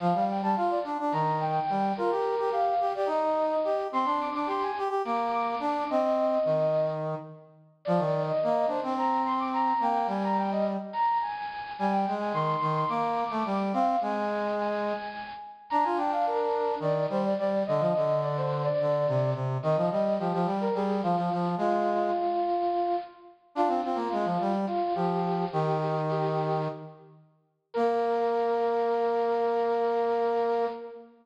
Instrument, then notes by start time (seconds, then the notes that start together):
brass section
0.00 F3 F5
0.14 G3
0.29 G5
0.42 G3 A5
0.56 F4 F5
0.70 D5
0.84 D4
0.99 D4
1.12 D#3 A#5
1.40 G5
1.70 G3
1.97 F4 A#4
2.11 G4
2.39 G4
2.50 G4 F5
2.80 G4
2.95 G4 D5
3.06 D#4 D#5
3.64 G4
3.92 C4 C6
4.05 D4
4.20 D6
4.34 D4 D6
4.46 G4 C6
4.63 G#5
4.78 G4
4.89 G4
5.05 A#3 D6
5.32 D6
5.60 D4
5.90 C4 D#5
6.45 D#3
7.85 F3 D5
7.98 D#3
8.26 D#5
8.43 A#3
8.67 D4 C5
8.83 C4
8.97 A#5
9.25 C6
9.39 D6
9.53 A#5
9.80 A#3 G5
10.07 G3 G#5
10.24 A#5
10.38 G5
10.52 D#5
10.93 A#5
11.21 G#5
11.78 G3 G#5
11.91 G5
12.07 G#3
12.20 G#5
12.33 D#3 C6
12.61 D#3
12.75 C6
12.89 A#3 D6
13.30 A3
13.45 G3
13.73 C4 F5
14.01 G#3 G#5
14.59 G#5
15.70 D4 A#5
15.83 F4 G#5
15.97 D4 G5
16.12 F5
16.27 A#4
16.80 D#3 D5
17.10 G3 C5
17.24 D5
17.38 G3 D5
17.66 D3 D#5
17.80 F3
17.96 D3
18.23 D5
18.37 C5
18.64 D5
18.81 D3
19.08 C3
19.34 C3
19.63 D#3 D#5
19.76 F3
19.91 G3 D#5
20.19 F3 G4
20.33 F3
20.45 G3
20.60 A#4
20.74 G3 G#4
21.03 F3 F4
21.16 F3
21.32 F3
21.58 G#3 F4
23.55 D4 F4
23.68 C4
23.84 C4 F4
23.95 A#3
24.12 G#3
24.25 F3
24.41 G3
24.67 F4
24.95 F3 G4
25.52 D#3 G4
25.81 G4
26.09 G4
27.74 A#3 A#4